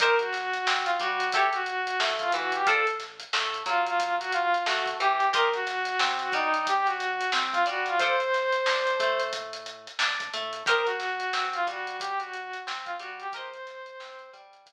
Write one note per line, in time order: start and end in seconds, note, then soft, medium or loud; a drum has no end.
0.00 0.59 C2 medium
0.00 0.16 D#4 medium
0.00 0.16 G4 medium
0.00 0.19 A#4 medium
0.00 0.16 A#4 medium
0.00 0.16 C5 loud
0.00 kick loud
0.00 closed hi-hat loud
0.18 0.81 F#4 medium
0.18 closed hi-hat medium
0.33 snare medium
0.33 closed hi-hat medium
0.53 closed hi-hat medium
0.67 0.96 C3 medium
0.67 0.96 C4 medium
0.67 snare loud
0.85 0.98 F4 medium
0.85 closed hi-hat medium
1.00 1.29 G2 medium
1.00 1.30 G3 medium
1.00 1.32 F#4 medium
1.00 kick medium
1.00 closed hi-hat medium
1.20 closed hi-hat medium
1.33 1.92 A1 medium
1.33 1.49 E4 medium
1.33 1.49 G4 medium
1.33 1.54 G4 medium
1.33 1.49 A4 medium
1.33 1.49 C#5 medium
1.33 kick medium
1.33 closed hi-hat medium
1.53 1.99 F#4 medium
1.53 closed hi-hat medium
1.66 closed hi-hat medium
1.87 closed hi-hat medium
2.00 2.29 A2 medium
2.00 2.30 A3 medium
2.00 snare loud
2.19 2.32 F4 medium
2.19 kick medium
2.19 closed hi-hat medium
2.32 2.63 D2 medium
2.32 2.63 E3 medium
2.32 2.53 F#4 medium
2.32 closed hi-hat medium
2.52 2.68 G4 medium
2.52 closed hi-hat medium
2.67 3.25 A1 medium
2.67 2.83 F4 medium
2.67 2.86 A4 medium
2.67 2.83 A4 medium
2.67 2.83 C5 medium
2.67 2.83 D5 medium
2.67 kick loud
2.67 closed hi-hat medium
2.87 closed hi-hat medium
3.00 snare soft
3.00 closed hi-hat medium
3.20 closed hi-hat medium
3.33 3.63 A2 medium
3.33 3.63 A3 medium
3.33 snare loud
3.54 closed hi-hat medium
3.66 4.55 E2 medium
3.66 4.54 F#3 medium
3.66 3.85 F4 medium
3.66 kick medium
3.66 closed hi-hat medium
3.87 4.15 F4 medium
3.87 closed hi-hat medium
4.00 kick medium
4.00 closed hi-hat loud
4.20 4.32 F#4 medium
4.20 closed hi-hat medium
4.32 4.63 F4 medium
4.32 closed hi-hat medium
4.54 closed hi-hat medium
4.66 4.96 A1 medium
4.66 4.96 A3 medium
4.66 4.85 F#4 medium
4.66 snare loud
4.86 kick medium
4.86 closed hi-hat medium
5.00 5.29 E2 medium
5.00 5.29 E3 medium
5.00 5.29 G4 medium
5.00 closed hi-hat medium
5.20 closed hi-hat medium
5.33 5.92 C2 medium
5.33 5.49 G4 medium
5.33 5.52 A#4 medium
5.33 5.49 A#4 medium
5.33 5.49 C5 medium
5.33 5.49 D#5 medium
5.33 kick loud
5.33 closed hi-hat loud
5.53 6.08 F#4 medium
5.53 closed hi-hat medium
5.67 snare medium
5.67 closed hi-hat medium
5.85 snare soft
5.85 closed hi-hat medium
5.99 6.29 C3 medium
5.99 6.29 C4 medium
5.99 snare loud
6.19 6.33 F#4 medium
6.19 closed hi-hat medium
6.32 7.21 G2 medium
6.32 7.21 G3 medium
6.32 6.66 D#4 medium
6.32 kick medium
6.32 closed hi-hat medium
6.54 closed hi-hat medium
6.67 6.87 G4 medium
6.67 kick medium
6.67 closed hi-hat loud
6.86 7.30 F#4 medium
6.86 snare soft
6.86 closed hi-hat medium
7.00 closed hi-hat medium
7.21 closed hi-hat medium
7.32 7.63 C2 medium
7.32 7.63 C4 medium
7.32 snare loud
7.52 7.65 F4 medium
7.52 kick medium
7.52 closed hi-hat medium
7.66 7.96 G2 medium
7.66 7.96 G3 medium
7.66 7.86 F#4 medium
7.66 closed hi-hat medium
7.86 7.99 F4 medium
7.86 closed hi-hat medium
7.99 8.59 D2 medium
7.99 8.16 F4 medium
7.99 8.16 A4 medium
7.99 9.21 C5 medium
7.99 8.16 C5 medium
7.99 kick medium
7.99 closed hi-hat medium
8.03 8.16 D5 medium
8.20 closed hi-hat medium
8.33 snare soft
8.33 closed hi-hat medium
8.53 snare soft
8.53 closed hi-hat medium
8.66 8.96 D3 medium
8.66 8.96 D4 medium
8.66 snare loud
8.87 closed hi-hat medium
9.00 9.88 A2 medium
9.00 9.88 A3 medium
9.00 kick medium
9.00 closed hi-hat medium
9.20 closed hi-hat medium
9.33 kick medium
9.33 closed hi-hat loud
9.53 closed hi-hat medium
9.66 closed hi-hat medium
9.87 closed hi-hat medium
9.99 10.29 D2 medium
9.99 10.29 D4 medium
9.99 snare loud
10.20 kick medium
10.20 closed hi-hat medium
10.33 10.63 A2 medium
10.33 10.63 A3 medium
10.33 closed hi-hat medium
10.53 closed hi-hat medium
10.66 11.25 C2 medium
10.66 10.83 G4 medium
10.66 10.86 A#4 medium
10.66 10.83 A#4 medium
10.66 10.83 C5 loud
10.66 10.83 D#5 medium
10.66 kick loud
10.66 closed hi-hat loud
10.86 11.45 F#4 medium
10.86 closed hi-hat medium
11.00 snare medium
11.00 closed hi-hat medium
11.20 closed hi-hat medium
11.33 11.63 C3 medium
11.33 11.63 C4 medium
11.33 snare medium
11.53 11.67 F4 medium
11.53 snare soft
11.53 closed hi-hat medium
11.67 12.55 G2 medium
11.67 12.55 G3 medium
11.67 11.96 F#4 medium
11.67 kick medium
11.67 snare soft
11.67 closed hi-hat medium
11.87 closed hi-hat medium
12.00 12.19 G4 medium
12.00 kick medium
12.00 closed hi-hat loud
12.19 12.59 F#4 medium
12.19 closed hi-hat medium
12.33 closed hi-hat medium
12.53 closed hi-hat medium
12.67 12.96 C2 medium
12.67 12.96 C4 medium
12.67 snare loud
12.85 12.98 F4 medium
12.85 kick medium
12.85 closed hi-hat medium
12.99 13.29 G2 medium
12.99 13.29 G3 medium
12.99 13.18 F#4 medium
12.99 snare soft
12.99 closed hi-hat medium
13.20 13.34 G4 medium
13.20 closed hi-hat medium
13.32 13.92 C2 medium
13.32 13.49 G4 medium
13.32 13.49 A#4 medium
13.32 14.30 C5 medium
13.32 13.49 C5 medium
13.32 13.49 D#5 medium
13.32 kick loud
13.32 closed hi-hat loud
13.54 closed hi-hat medium
13.67 snare medium
13.67 closed hi-hat medium
13.86 closed hi-hat medium
14.00 14.29 C3 medium
14.00 14.29 C4 medium
14.00 snare loud
14.19 closed hi-hat medium
14.33 14.73 G2 medium
14.33 14.73 G3 medium
14.33 kick medium
14.33 closed hi-hat medium
14.53 closed hi-hat medium
14.66 kick medium
14.66 closed hi-hat loud